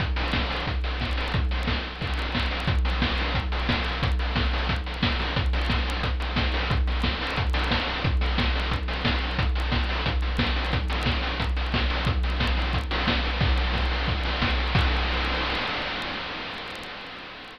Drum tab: CC |--------|--------|--------|--------|
HH |xo-oxo-o|xo--oo-o|xo-oxo-o|xo-oxo-o|
SD |--o---o-|--o---o-|--o---o-|--o---o-|
BD |o-o-o-o-|o-o-o-o-|o-o-o-o-|o-o-o-o-|

CC |--------|--------|--------|--------|
HH |xo-oxo-o|xo-oxo-o|xo-oxo-o|xo-oxo-o|
SD |--o---o-|--o---o-|--o---o-|--o---o-|
BD |o-o-o-o-|o-o-o-o-|o-o-o-o-|o-o-o-o-|

CC |--------|--------|x-------|x-------|
HH |xo-oxo-o|xo-oxo-o|-o-oxo-o|--------|
SD |--o---o-|--o---o-|--o---o-|--------|
BD |o-o-o-o-|o-o-o-o-|o-o-o-o-|o-------|